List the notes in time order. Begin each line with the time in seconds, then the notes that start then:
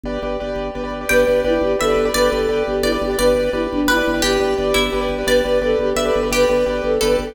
0.03 G1 G4 B4 D5
0.22 G1 G4 B4 D5
0.40 G1 G4 B4 D5
0.56 G1
0.75 G1 G4 B4 D5
0.84 G4 B4 D5
0.90 G1
1.01 G4 B4 D5
1.09 G1 G4 B4 D5 G5
1.27 G1 G4 B4 D5
1.44 G1 E4 G4 B4 D5
1.61 G1 G4
1.79 G1 G4 A4 B4 D5 E5
1.88 G4 B4 D5
1.96 G1
2.05 G4 B4 D5
2.14 G1 G4 B4 D5
2.32 G1 G4 A4 B4 D5
2.48 G1 G4 B4 D5
2.67 G1 G4
2.83 G1 E4 G4 B4 D5
2.92 G4 B4 D5
3.01 G1 G4
3.10 G4 B4 D5
3.17 G1 G4 B4 D5
3.35 G1 G4 B4 D5
3.53 G1 E4 G4 B4 D5
3.71 G1 D4
3.87 G1 E4 G4 B4 D5
3.97 G4 B4 D5
4.07 G1
4.14 G4 B4 D5
4.22 G1 G4 B4 D5
4.40 G1 G4 B4 D5
4.58 G1 G4 B4 D5
4.74 G1 E4
4.92 G1 G4 B4 D5
5.01 G4 B4 D5
5.09 G1
5.18 G4 B4 D5
5.26 G1 G4 B4 D5
5.44 G1 G4 B4 D5
5.61 G1 G4 A4 B4 D5
5.79 G1 G4
5.96 G1 G4 A4 B4 D5 E5
6.05 G4 B4 D5
6.16 G1
6.23 G4 B4 D5
6.31 G1 G4 B4 D5
6.49 G1 G4 B4 D5
6.66 G1 G4 B4 D5
6.83 G1 A4
7.01 G1 G4 A4 B4 D5
7.10 G4 B4 D5
7.18 G1 A4
7.27 G4 B4 D5